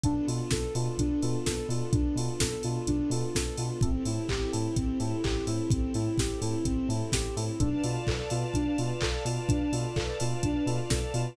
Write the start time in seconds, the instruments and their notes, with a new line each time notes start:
0.04 synth bass 2 B1, string ensemble 1 B3 D4 F4 A4, electric piano 1 B3 D4 F4 A4, ocarina D4, kick, closed hi-hat
0.27 synth bass 2 B2, electric piano 1 B3 D4 F4 A4, ocarina F4, open hi-hat
0.51 synth bass 2 B1, ocarina A4, kick, snare
0.75 synth bass 2 B2, electric piano 1 B3 D4 F4 A4, ocarina F4, open hi-hat
0.98 synth bass 2 B1, ocarina D4, kick, closed hi-hat
1.22 synth bass 2 B2, electric piano 1 B3 D4 F4 A4, ocarina F4, open hi-hat
1.46 synth bass 2 B1, ocarina A4, kick, snare
1.69 synth bass 2 B2, electric piano 1 B3 D4 F4 A4, ocarina F4, open hi-hat
1.93 synth bass 2 B1, ocarina D4, kick, closed hi-hat
2.15 synth bass 2 B2, electric piano 1 B3 D4 F4 A4, ocarina F4, open hi-hat
2.40 synth bass 2 B1, ocarina A4, kick, snare
2.63 synth bass 2 B2, electric piano 1 B3 D4 F4 A4, ocarina F4, open hi-hat
2.87 synth bass 2 B1, ocarina D4, kick, closed hi-hat
3.10 synth bass 2 B2, electric piano 1 B3 D4 F4 A4, ocarina F4, open hi-hat
3.35 synth bass 2 B1, ocarina A4, kick, snare
3.57 synth bass 2 B2, electric piano 1 B3 D4 F4 A4, ocarina F4, open hi-hat
3.81 synth bass 2 A1, string ensemble 1 C4 E4 G4 A4, ocarina C4, electric piano 1 C4 E4 G4 A4, kick, closed hi-hat
4.05 synth bass 2 A2, electric piano 1 C4 E4 G4 A4, ocarina E4, open hi-hat
4.29 synth bass 2 A1, ocarina G4, kick, clap
4.53 synth bass 2 A2, electric piano 1 C4 E4 G4 A4, ocarina E4, open hi-hat
4.76 synth bass 2 A1, ocarina C4, kick, closed hi-hat
5.00 synth bass 2 A2, electric piano 1 C4 E4 G4 A4, ocarina E4, open hi-hat
5.24 synth bass 2 A1, ocarina G4, kick, clap
5.47 synth bass 2 A2, electric piano 1 C4 E4 G4 A4, ocarina E4, open hi-hat
5.70 synth bass 2 A1, ocarina C4, kick, closed hi-hat
5.94 synth bass 2 A2, electric piano 1 C4 E4 G4 A4, ocarina E4, open hi-hat
6.18 synth bass 2 A1, ocarina G4, kick, snare
6.41 synth bass 2 A2, electric piano 1 C4 E4 G4 A4, ocarina E4, open hi-hat
6.65 synth bass 2 A1, ocarina C4, kick, closed hi-hat
6.89 synth bass 2 A2, electric piano 1 C4 E4 G4 A4, ocarina E4, open hi-hat
7.12 synth bass 2 A1, ocarina G4, kick, snare
7.37 synth bass 2 A2, electric piano 1 C4 E4 G4 A4, ocarina E4, open hi-hat
7.60 synth bass 2 B1, electric piano 1 B3 D4 F4 A4, ocarina D4, string ensemble 1 B4 D5 F5 A5, kick, closed hi-hat
7.84 synth bass 2 B2, electric piano 1 B3 D4 F4 A4, ocarina F4, open hi-hat
8.07 synth bass 2 B1, ocarina A4, kick, clap
8.30 synth bass 2 B2, electric piano 1 B3 D4 F4 A4, ocarina F4, open hi-hat
8.54 synth bass 2 B1, ocarina D4, kick, closed hi-hat
8.78 synth bass 2 B2, electric piano 1 B3 D4 F4 A4, ocarina F4, open hi-hat
9.01 synth bass 2 B1, ocarina A4, kick, clap
9.25 synth bass 2 B2, electric piano 1 B3 D4 F4 A4, ocarina F4, open hi-hat
9.49 synth bass 2 B1, ocarina D4, kick, closed hi-hat
9.72 synth bass 2 B2, electric piano 1 B3 D4 F4 A4, ocarina F4, open hi-hat
9.96 synth bass 2 B1, ocarina A4, kick, clap
10.20 synth bass 2 B2, electric piano 1 B3 D4 F4 A4, ocarina F4, open hi-hat
10.43 synth bass 2 B1, ocarina D4, kick, closed hi-hat
10.66 synth bass 2 B2, electric piano 1 B3 D4 F4 A4, ocarina F4, open hi-hat
10.90 synth bass 2 B1, ocarina A4, kick, snare
11.14 synth bass 2 B2, electric piano 1 B3 D4 F4 A4, ocarina F4, open hi-hat